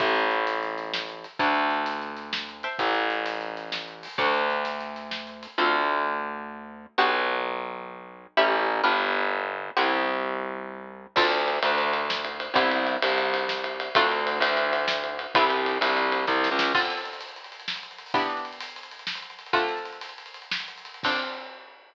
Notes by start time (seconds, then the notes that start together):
0.00 A1 C5 E5 G5 A5, kick, closed hi-hat
0.15 closed hi-hat
0.31 closed hi-hat
0.47 closed hi-hat
0.63 closed hi-hat
0.78 closed hi-hat
0.94 snare
1.09 closed hi-hat
1.24 closed hi-hat
1.39 D2 C#5 D5 F#5 A5, kick, closed hi-hat
1.55 closed hi-hat
1.70 closed hi-hat
1.86 closed hi-hat
2.02 closed hi-hat
2.17 closed hi-hat
2.33 snare
2.49 closed hi-hat
2.63 C5 E5 G5 A5, closed hi-hat
2.79 A1, kick, closed hi-hat
2.95 closed hi-hat
3.10 closed hi-hat
3.26 closed hi-hat
3.41 closed hi-hat
3.57 closed hi-hat
3.72 snare
3.88 closed hi-hat
4.03 open hi-hat
4.18 D2 C#5 D5 F#5 A5, kick, closed hi-hat
4.34 closed hi-hat
4.50 closed hi-hat
4.65 closed hi-hat
4.80 closed hi-hat
4.96 closed hi-hat
5.11 snare
5.27 closed hi-hat
5.43 closed hi-hat
5.58 D2 C4 D4 F4 A4
6.98 B1 B3 D4 F#4 G4
8.37 A1 A3 C#4 E4 G4
8.84 G1 B3 D4 F4 G4
9.77 C2 B3 C4 E4 G4
11.16 D2 C4 D4 F4 A4, kick, crash
11.32 ride
11.48 ride
11.63 D2, ride
11.78 ride
11.93 ride
12.10 snare
12.25 ride
12.40 ride
12.54 C2 B3 C4 E4 G4, kick, ride
12.71 ride
12.87 ride
13.02 C2, ride
13.18 ride
13.34 ride
13.49 snare
13.64 ride
13.80 ride
13.95 D2 A3 C4 D4 F4, kick, ride
14.12 ride
14.27 ride
14.40 D2, ride
14.57 ride
14.73 ride
14.88 snare
15.04 ride
15.19 ride
15.35 C2 G3 B3 C4 E4, kick, ride
15.50 ride
15.66 ride
15.81 C2, ride
15.97 ride
16.12 ride
16.27 C2, kick, snare
16.44 snare
16.51 C#2
16.59 snare
16.74 D3 C4 F4 A4, kick, crash
16.82 closed hi-hat
16.90 closed hi-hat
16.97 closed hi-hat
17.05 closed hi-hat
17.13 closed hi-hat
17.21 closed hi-hat
17.28 closed hi-hat
17.36 closed hi-hat
17.44 closed hi-hat
17.52 closed hi-hat
17.60 closed hi-hat
17.68 snare
17.76 closed hi-hat
17.83 closed hi-hat
17.91 closed hi-hat
17.98 closed hi-hat
18.06 open hi-hat
18.14 E3 B3 D4 G4, kick, closed hi-hat
18.22 closed hi-hat
18.30 closed hi-hat
18.37 closed hi-hat
18.45 closed hi-hat
18.53 closed hi-hat
18.60 closed hi-hat
18.68 closed hi-hat
18.76 closed hi-hat
18.83 closed hi-hat
18.91 closed hi-hat
18.99 closed hi-hat
19.07 snare
19.15 closed hi-hat
19.22 closed hi-hat
19.30 closed hi-hat
19.39 closed hi-hat
19.46 closed hi-hat
19.53 D3 A3 C4 F4, kick, closed hi-hat
19.61 closed hi-hat
19.68 closed hi-hat
19.77 closed hi-hat
19.85 closed hi-hat
19.92 closed hi-hat
20.01 closed hi-hat
20.09 closed hi-hat
20.18 closed hi-hat
20.26 closed hi-hat
20.34 closed hi-hat
20.42 closed hi-hat
20.51 snare
20.60 closed hi-hat
20.68 closed hi-hat
20.77 closed hi-hat
20.85 closed hi-hat
20.94 closed hi-hat
21.03 C4 D4 F4 A4, kick, crash